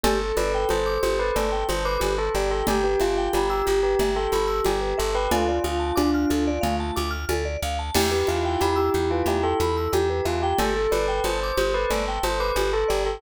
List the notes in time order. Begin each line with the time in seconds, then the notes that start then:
0.04 G1 G4 A4, cowbell, low conga
0.21 A4
0.37 G1 B4 D5, high conga
0.54 G5
0.69 G1 C5 A5, cowbell, high conga
0.86 D6
1.03 G1 G4 C5, high conga
1.19 A4 B4
1.36 G1 A4 D5, cowbell, low conga
1.52 G5
1.69 G1 C5 A5, high conga
1.85 B4 D6
2.00 G1 G4, cowbell, high conga
2.18 A4
2.35 G1 G4 D5
2.51 A4 G5
2.67 G1 G4, cowbell, low conga
2.84 G4 B4
3.00 G1 F4 E5, high conga
3.17 G5
3.33 G1 G4 B5, cowbell, high conga
3.50 G4 E6
3.66 G1 G4, high conga
3.83 G4 B4
3.99 G1 G4 E5, cowbell, low conga
4.16 A4 G5
4.32 G1 A4 B5, high conga
4.47 E6
4.65 G1 G4, cowbell, high conga
4.81 B4
4.98 G1 A4 E5
5.15 B4 G5
5.31 D2 F4 A4, cowbell, low conga
5.48 D5
5.64 D2 F5, high conga
5.80 A5
5.96 D2 D4 D6, cowbell, high conga
6.14 F6
6.30 D2 A4, high conga
6.47 D5
6.61 D2 A3 F5, cowbell, low conga
6.80 A5
6.96 D2 D6, high conga
7.11 F6
7.29 D2 A4, cowbell, high conga
7.45 D5
7.63 D2 F5
7.79 A5
7.95 E2 E4 G4, crash, cowbell, low conga
8.11 G4 B4
8.27 E2 F4 E5, high conga
8.45 G5
8.60 E2 G4 B5, cowbell, high conga
8.76 G4 E6
8.94 E2 G4, high conga
9.11 F4 B4
9.26 E2 G4 E5, cowbell, low conga
9.43 A4 G5
9.60 E2 A4 B5, high conga
9.77 E6
9.92 E2 G4, cowbell, high conga
10.10 B4
10.25 E2 F4 E5
10.42 G4 G5
10.59 G1 G4 A4, cowbell, low conga
10.76 A4
10.91 G1 B4 D5, high conga
11.08 G5
11.24 G1 C5 A5, cowbell, high conga
11.43 D6
11.57 G1 G4 C5, high conga
11.74 A4 B4
11.90 G1 A4 D5, cowbell, low conga
12.08 G5
12.23 G1 C5 A5, high conga
12.40 B4 D6
12.56 G1 G4, cowbell, high conga
12.73 A4
12.88 G1 G4 D5
13.05 A4 G5